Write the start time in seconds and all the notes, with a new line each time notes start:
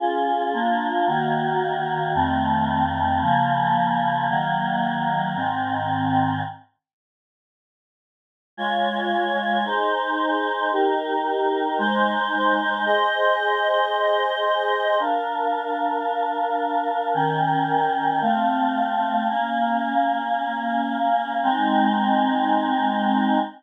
0.00 C#4 F4 G#4
0.53 A#3 D4 F4
1.07 D#3 A#3 F#4
2.15 F2 D#3 A3 C4
3.21 C#3 F3 A#3
4.29 D#3 F#3 A#3
5.36 G#2 D#3 C4
8.57 G#3 F4 C#5
9.64 D#4 G#4 C5
10.71 D#4 G4 A#4
11.78 G#3 D#4 C5
12.86 G#4 C5 D#5
15.00 D4 A#4 F5
17.14 D#3 C#4 A#4 G5
18.21 A3 C4 F5
19.29 A#3 C#4 F5
21.43 G#3 C4 D#4